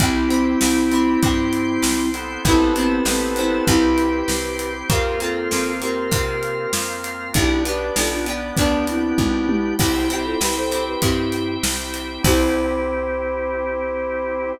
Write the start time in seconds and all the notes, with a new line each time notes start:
0.00 C2 C4 E4 G4 C5 E5 G5, kick, closed hi-hat
0.30 C4 E4 G4, closed hi-hat
0.61 C2 C4 E4 G4, snare
0.91 C4 E4 G4, closed hi-hat
1.22 G2 C4 E4 G4 C5 G5 C6, kick, closed hi-hat
1.53 closed hi-hat
1.82 C2, snare
2.14 B3 C4 E4 A4, closed hi-hat
2.45 A1 B3 C4 E4 G4 B4 C5 E5 A5, kick, closed hi-hat
2.49 A4
2.76 B3 C4 E4, closed hi-hat
2.80 A4
3.05 A1 B3 C4 E4 A4 B4 C5 A5, snare
3.11 A4
3.36 B3 C4 E4, closed hi-hat
3.41 A4
3.67 C2 C4 E4 G4 C5 E5 G5, kick, closed hi-hat
3.98 closed hi-hat
4.28 C2 C5 G5 C6, snare
4.59 closed hi-hat
4.90 F2 A#3 C4 F4 G4 A#4 C5 F5, kick, closed hi-hat
5.20 A#3 C4 F4 A4, closed hi-hat
5.51 F2 A#3 C4 F4, snare
5.81 A#3 C4 F4 G4 A#4, closed hi-hat
6.11 C3 A#3 C4 F4 A#4 F5, kick, closed hi-hat
6.43 closed hi-hat
6.73 F2, snare
7.04 closed hi-hat
7.33 B1 B3 D4 E4 G4 B4 D5 G5, kick, closed hi-hat
7.38 G4
7.65 B3 D4 G4 B4, closed hi-hat
7.96 B1 B3 D4 F4 G4 A4, snare
8.11 D4 F4
8.26 B3 D4 G4, closed hi-hat
8.57 D2 B3 D4 G4 B4 G5, kick, closed hi-hat
8.87 C4 E4, closed hi-hat
9.18 B1, kick, high tom
9.49 E4 G4, high tom
9.79 C2 C4 E4 G4 C5 E5 G5, kick, crash
10.10 C4 E4 G4, closed hi-hat
10.25 F4 A4
10.40 C2 C4 E4 G4 B4, snare
10.56 A4 C5
10.71 C4 E4 G4, closed hi-hat
10.87 G4 B4
11.02 G2 C4 E4 G4, kick, closed hi-hat
11.32 closed hi-hat
11.63 C2, snare
11.94 closed hi-hat
12.23 C2 C4 E4 G4 C5, kick, crash
12.28 G4